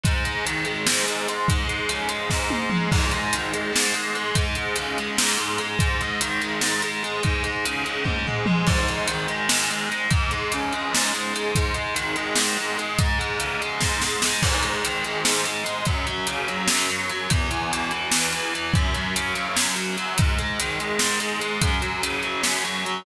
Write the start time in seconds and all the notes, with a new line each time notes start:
0.04 G#2, kick, closed hi-hat
0.24 G#3, closed hi-hat
0.45 D#3, closed hi-hat
0.65 G#3, closed hi-hat
0.87 G#2, snare
1.05 G#3, closed hi-hat
1.28 G#3, closed hi-hat
1.48 G#2, kick, closed hi-hat
1.67 G#3, closed hi-hat
1.89 C#3, closed hi-hat
2.09 G#3, closed hi-hat
2.30 G#2, kick, snare
2.50 G#3, high tom
2.70 G#3, mid tom
2.91 G#2, kick, crash
3.11 G#3, closed hi-hat
3.33 D#3, closed hi-hat
3.53 G#3, closed hi-hat
3.72 G#2, snare
3.94 G#3, closed hi-hat
4.15 G#3, closed hi-hat
4.35 G#2, kick, closed hi-hat
4.55 G#3, closed hi-hat
4.76 C#3, closed hi-hat
4.98 G#3, closed hi-hat
5.17 G#2, snare
5.37 G#3, closed hi-hat
5.58 G#3, closed hi-hat
5.79 G#2, kick, closed hi-hat
6.01 G#3, closed hi-hat
6.21 D#3, closed hi-hat
6.41 G#3, closed hi-hat
6.61 G#2, snare
6.82 G#3, closed hi-hat
7.03 G#3, closed hi-hat
7.23 G#2, kick, closed hi-hat
7.43 G#3, closed hi-hat
7.65 C#3, closed hi-hat
7.84 G#3, closed hi-hat
8.04 G#2, kick, high tom
8.27 G#3, floor tom
8.46 G#3, mid tom
8.67 G#2, kick, crash
8.88 G#3, closed hi-hat
9.08 D#3, closed hi-hat
9.28 G#3, closed hi-hat
9.49 G#2, snare
9.71 G#3, closed hi-hat
9.89 G#3, closed hi-hat
10.10 G#2, kick, closed hi-hat
10.31 G#3, closed hi-hat
10.52 C#3, closed hi-hat
10.73 G#3, closed hi-hat
10.93 G#2, snare
11.13 G#3, closed hi-hat
11.34 G#3, closed hi-hat
11.55 G#2, kick, closed hi-hat
11.74 G#3, closed hi-hat
11.95 D#3, closed hi-hat
12.16 G#3, closed hi-hat
12.36 G#2, snare
12.57 G#3, closed hi-hat
12.78 G#3, closed hi-hat
12.99 G#2, kick, closed hi-hat
13.19 G#3, closed hi-hat
13.39 C#3, closed hi-hat
13.61 G#3, closed hi-hat
13.81 G#2, kick, snare
14.01 G#3, snare
14.22 G#3, snare
14.42 G#2, kick, crash
14.63 G#3, closed hi-hat
14.84 D#3, closed hi-hat
15.04 G#3, closed hi-hat
15.24 G#2, snare
15.45 G#3, closed hi-hat
15.64 G#3, closed hi-hat
15.85 F#2, kick, closed hi-hat
16.06 F#3, closed hi-hat
16.27 C#3, closed hi-hat
16.48 F#3, closed hi-hat
16.68 F#2, snare
16.90 F#3, closed hi-hat
17.10 F#3, closed hi-hat
17.30 E2, kick, closed hi-hat
17.50 E3, closed hi-hat
17.71 B2, closed hi-hat
17.91 E3, closed hi-hat
18.11 E2, snare
18.32 E3, closed hi-hat
18.54 E3, closed hi-hat
18.74 F#2, kick, closed hi-hat
18.94 F#3, closed hi-hat
19.16 C#3, closed hi-hat
19.35 F#3, closed hi-hat
19.56 F#2, snare
19.75 F#3, closed hi-hat
19.97 F#3, closed hi-hat
20.18 G#2, kick, closed hi-hat
20.38 G#3, closed hi-hat
20.59 D#3, closed hi-hat
20.79 G#3, closed hi-hat
20.99 G#2, snare
21.20 G#3, closed hi-hat
21.40 G#3, closed hi-hat
21.61 F#2, kick, closed hi-hat
21.82 F#3, closed hi-hat
22.02 C#3, closed hi-hat
22.23 F#3, closed hi-hat
22.43 F#2, snare
22.64 F#3, closed hi-hat
22.85 F#3, closed hi-hat